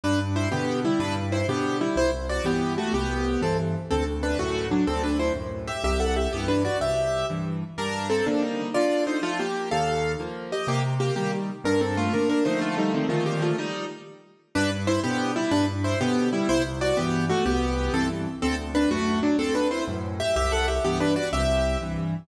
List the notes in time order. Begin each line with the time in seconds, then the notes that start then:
0.04 G2 D4 B4
0.36 E4 C5
0.51 B2 D3 B3 G4
0.85 G3 E4
0.99 G2 D4 B4
1.32 E4 C5
1.48 B2 D3 B3 G4
1.81 G3 E4
1.96 C2 E4 C5
2.29 F#4 D5
2.44 G2 E3 B3 G4
2.78 A3 F#4
2.93 C2 B3 G4
3.41 G2 E3 C4 A4
3.91 D2 C4 A4
4.23 D4 B4
4.39 F#2 A2 A3 F#4
4.71 F#3 D4
4.87 D2 C4 A4
5.04 D4 B4
5.19 E4 C5
5.36 F#2 A2
5.67 G4 E5
5.84 C2 G4 E5
6.00 A4 F#5
6.16 G4 E5
6.33 G2 E3 B3 G4
6.48 D4 B4
6.65 F#4 D5
6.81 C2 G4 E5
7.30 G2 E3
7.78 G2 D4 A#4
8.10 C4 A4
8.26 D3 F3 A#3 D4
8.42 G3 D#4
8.74 D3 F4 D5
9.07 D#4 C5
9.22 F3 A3 F4
9.39 A#3 G4
9.71 D#2 A4 F5
10.20 F3 A#3
10.52 G4 D#5
10.67 C3 A#3 G4
11.00 A#3 G4
11.16 D#3 G3 A#3 G4
11.64 G2 D4 A#4
11.81 C4 A4
11.97 A3 F4
12.13 D3 A#3 D4 A#4
12.29 D4 A#4
12.45 D3 F3 A3 D#4 C5
12.61 A3 F4
12.78 G3 D#4
12.94 D#3 C4
13.09 A#2 D#3 F3 A3 F4
13.26 A#3 G4
13.42 A3 F4
13.58 G3 D#4
14.55 G2 D4 B4
14.87 E4 C5
15.03 B2 D3 B3 G4
15.36 G3 E4
15.51 G2 D4 B4
15.84 E4 C5
16.00 B2 D3 B3 G4
16.33 G3 E4
16.49 C2 E4 C5
16.81 F#4 D5
16.97 G2 E3 B3 G4
17.30 A3 F#4
17.46 C2 B3 G4
17.93 G2 E3 C4 A4
18.42 D2 C4 A4
18.75 D4 B4
18.91 F#2 A2 A3 F#4
19.23 F#3 D4
19.38 D2 C4 A4
19.55 D4 B4
19.71 E4 C5
19.88 F#2 A2
20.20 G4 E5
20.36 C2 G4 E5
20.52 A4 F#5
20.68 G4 E5
20.84 G2 E3 B3 G4
21.00 D4 B4
21.16 F#4 D5
21.33 C2 G4 E5
21.81 G2 E3